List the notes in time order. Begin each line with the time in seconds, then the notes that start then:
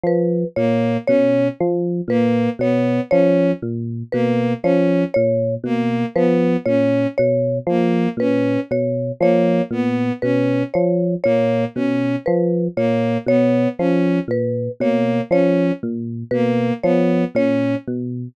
0.04 F3 B4
0.56 A#2 A#3 C#5
1.07 B2 C#4 C#5
1.60 F3
2.08 A#2 A#3 B4
2.59 B2 B3 C#5
3.11 F3 C#4 C#5
3.62 A#2
4.12 B2 A#3 B4
4.63 F3 C#4 C#5
5.14 A#2 C#5
5.64 B2 A#3
6.16 F3 B3 B4
6.65 A#2 C#4 C#5
7.18 B2 C#5
7.67 F3 A#3
8.17 A#2 C#4 B4
8.71 B2 C#5
9.21 F3 A#3 C#5
9.71 A#2 B3
10.22 B2 C#4 B4
10.74 F3 C#5
11.24 A#2 A#3 C#5
11.75 B2 C#4
12.26 F3 B4
12.77 A#2 A#3 C#5
13.26 B2 B3 C#5
13.79 F3 C#4
14.28 A#2 B4
14.80 B2 A#3 C#5
15.31 F3 C#4 C#5
15.83 A#2
16.31 B2 A#3 B4
16.83 F3 B3 C#5
17.35 A#2 C#4 C#5
17.87 B2